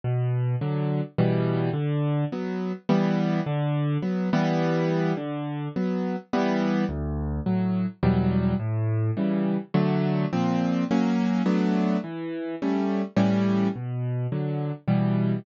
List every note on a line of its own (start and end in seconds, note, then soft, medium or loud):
0.04 0.56 B2 medium
0.61 1.01 D3 medium
0.61 1.01 F#3 medium
1.18 1.70 B2 loud
1.18 1.70 E3 loud
1.18 1.70 G3 loud
1.73 2.25 D3 loud
2.32 2.72 F#3 medium
2.32 2.72 B3 medium
2.89 3.40 E3 loud
2.89 3.40 G3 loud
2.89 3.40 B3 loud
3.46 3.98 D3 loud
4.02 4.30 F#3 medium
4.02 4.30 B3 medium
4.33 5.13 E3 loud
4.33 5.13 G3 loud
4.33 5.13 B3 loud
5.17 5.68 D3 medium
5.76 6.16 F#3 medium
5.76 6.16 B3 medium
6.33 6.85 E3 loud
6.33 6.85 G3 loud
6.33 6.85 B3 loud
6.89 7.40 D2 loud
7.46 7.86 A2 medium
7.46 7.86 F#3 medium
8.03 8.54 E2 loud
8.03 8.54 B2 medium
8.03 8.54 F#3 loud
8.03 8.54 G3 loud
8.59 9.11 A2 loud
9.17 9.57 C#3 medium
9.17 9.57 E3 medium
9.17 9.57 G3 medium
9.74 10.26 D3 loud
9.74 10.26 F#3 loud
9.74 10.26 A3 loud
10.33 10.84 A#2 loud
10.33 10.84 F3 medium
10.33 10.84 C4 loud
10.91 11.42 F#3 loud
10.91 11.42 A#3 loud
10.91 11.42 C#4 loud
11.46 11.97 F#3 loud
11.46 11.97 A3 loud
11.46 11.97 B3 loud
11.46 11.97 D4 medium
12.04 12.55 E3 medium
12.62 13.02 G3 medium
12.62 13.02 A3 medium
12.62 13.02 C#4 medium
13.16 13.68 A2 medium
13.16 13.68 E3 loud
13.16 13.68 G3 loud
13.16 13.68 C#4 loud
13.75 14.27 B2 medium
14.32 14.72 D3 medium
14.32 14.72 F#3 medium
14.88 15.39 B2 medium
14.88 15.39 E3 medium
14.88 15.39 G3 medium